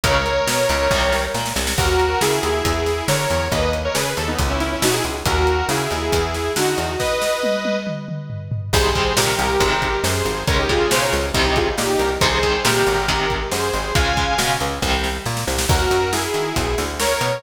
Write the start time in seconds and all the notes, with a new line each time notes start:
0.04 C#2 C#3 G#3 A#4 C#5, kick, closed hi-hat
0.26 closed hi-hat
0.47 B2 B3, snare
0.69 C#2 C#3, closed hi-hat
0.91 C2 C3 D#3 G3, kick, snare
1.13 snare
1.34 A#2 A#3, snare
1.46 snare
1.56 C2 C3, snare
1.67 snare
1.78 D#2 F#4 A#4, kick, crash
2.00 closed hi-hat
2.21 C#3 E4 G#4, snare
2.43 D#2, closed hi-hat
2.65 E2, kick, closed hi-hat
2.86 snare, closed hi-hat
3.08 D3 A#4 C#5, snare
3.30 E2, closed hi-hat
3.52 D#2 B4 D#5, kick, closed hi-hat
3.73 closed hi-hat
3.85 A#4 C#5
3.95 C#3 G#4 B4, snare
4.17 D#2 A4, closed hi-hat
4.28 B3 D#4
4.39 C#2, kick, closed hi-hat
4.50 C#4 E4
4.60 C#4 E4, snare, closed hi-hat
4.72 C#4 E4
4.82 B2 D#4 F#4, snare
4.93 E4 G#4
5.04 C#2, closed hi-hat
5.25 D#2 F#4 A#4, kick, closed hi-hat
5.47 closed hi-hat
5.69 C#3 E4 G#4, snare
5.91 D#2, closed hi-hat
6.12 E2, kick, closed hi-hat
6.34 snare, closed hi-hat
6.56 D3 D#4 F#4, snare
6.78 E2, closed hi-hat
6.99 B4 D#5, kick, snare
7.22 snare
7.43 high tom
7.65 high tom
7.87 mid tom
8.08 mid tom
8.30 floor tom
8.52 floor tom
8.73 C2 C3 D#3 G3 G#4 C5, kick, crash
8.95 C3 D#3 G3, kick, closed hi-hat
9.17 A#2 C3 D#3 G3 G4 A#4, snare
9.38 C2, closed hi-hat
9.60 G#1 C3 D#3 G#3, kick, closed hi-hat
9.82 kick, closed hi-hat
10.04 F#2 G#4 C5, snare
10.25 G#1, closed hi-hat
10.47 C#2 C#3 G#3 A#4 C#5, kick, closed hi-hat
10.59 D#4 G4
10.69 C#3 G#3 F4 G#4, kick, closed hi-hat
10.91 B2 C#3 G#3 G#4 C5, snare
11.01 A#4 C#5
11.13 C#2, closed hi-hat
11.34 C2 C3 D#3 G3 C5 D#5, kick, closed hi-hat
11.45 D#4 G4
11.56 F4 G#4, kick, closed hi-hat
11.78 A#2 D#4 G4, snare
11.99 C2 G4 A#4, closed hi-hat
12.21 C2 C3 D#3 G3 G#4 C5, kick, closed hi-hat
12.43 C3 D#3 G3, kick, closed hi-hat
12.65 A#2 C3 D#3 G3 G4 A#4, snare
12.87 G#1, closed hi-hat
13.08 C3 D#3 G#3, kick, closed hi-hat
13.30 kick, closed hi-hat
13.51 F#2 G#4 C5, snare
13.73 G#1, closed hi-hat
13.95 C#2 C#3 G#3 F5 G#5, kick, closed hi-hat
14.17 C#3 G#3, kick, closed hi-hat
14.38 B2 C#3 G#3, snare
14.60 C#2, closed hi-hat
14.82 C2 C3 D#3 G3, kick, snare
15.04 snare
15.26 A#2, snare
15.37 snare
15.47 C2, snare
15.58 snare
15.69 D#2 F#4 A#4, kick, crash
15.91 F#2, closed hi-hat
16.13 E4 G#4, snare
16.34 D#3, closed hi-hat
16.56 B1, kick, closed hi-hat
16.78 D2, snare, closed hi-hat
17.00 A#4 C#5, snare
17.21 B2, closed hi-hat